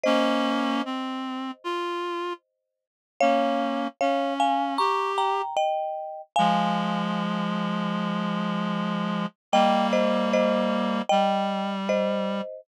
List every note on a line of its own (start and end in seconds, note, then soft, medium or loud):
0.03 0.82 A#3 loud
0.03 0.82 C#4 loud
0.03 2.85 C5 medium
0.03 2.85 D#5 medium
0.85 1.51 C4 medium
1.64 2.33 F4 medium
3.20 3.88 A#3 medium
3.20 3.88 C#4 medium
3.20 3.88 C#5 medium
3.20 3.88 F5 loud
4.01 4.78 C#4 medium
4.01 4.34 C#5 medium
4.01 4.34 F5 medium
4.40 4.74 F5 medium
4.40 4.74 G#5 medium
4.78 5.42 G4 loud
4.78 5.12 A#5 medium
4.78 5.12 C#6 medium
5.18 5.55 G5 medium
5.18 5.55 A#5 medium
5.57 6.22 D#5 medium
5.57 6.22 G5 medium
6.36 9.26 F3 medium
6.36 9.26 G#3 loud
6.36 7.94 F5 medium
6.36 7.94 G#5 medium
9.52 11.02 G3 medium
9.52 11.02 A#3 loud
9.52 9.87 D#5 medium
9.52 9.87 G5 loud
9.93 10.30 C5 medium
9.93 10.30 D#5 medium
10.33 11.02 C5 medium
10.33 11.02 D#5 medium
11.09 12.41 G3 loud
11.09 11.75 D#5 medium
11.09 11.75 G5 medium
11.89 12.61 C5 medium
11.89 12.61 D#5 medium